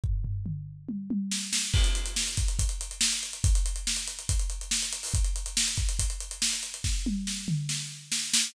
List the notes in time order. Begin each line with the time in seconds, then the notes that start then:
0.04 kick, floor tom
0.24 floor tom
0.46 mid tom
0.88 high tom
1.10 high tom
1.31 snare
1.53 snare
1.73 kick, crash
1.84 closed hi-hat
1.95 closed hi-hat
2.05 closed hi-hat
2.16 snare
2.27 closed hi-hat
2.37 kick, closed hi-hat
2.48 closed hi-hat
2.59 kick, closed hi-hat
2.69 closed hi-hat
2.81 closed hi-hat
2.91 closed hi-hat
3.01 snare
3.12 closed hi-hat
3.23 closed hi-hat
3.33 closed hi-hat
3.44 kick, closed hi-hat
3.55 closed hi-hat
3.66 closed hi-hat
3.76 closed hi-hat
3.87 snare
3.96 closed hi-hat
4.07 closed hi-hat
4.19 closed hi-hat
4.29 kick, closed hi-hat
4.39 closed hi-hat
4.50 closed hi-hat
4.61 closed hi-hat
4.71 snare
4.82 closed hi-hat
4.92 closed hi-hat
5.03 open hi-hat
5.14 kick, closed hi-hat
5.24 closed hi-hat
5.36 closed hi-hat
5.46 closed hi-hat
5.57 snare
5.67 closed hi-hat
5.77 kick, closed hi-hat
5.89 closed hi-hat
5.99 kick, closed hi-hat
6.10 closed hi-hat
6.20 closed hi-hat
6.31 closed hi-hat
6.42 snare
6.53 closed hi-hat
6.63 closed hi-hat
6.74 closed hi-hat
6.84 kick, snare
7.06 high tom
7.27 snare
7.48 mid tom
7.69 snare
8.12 snare
8.34 snare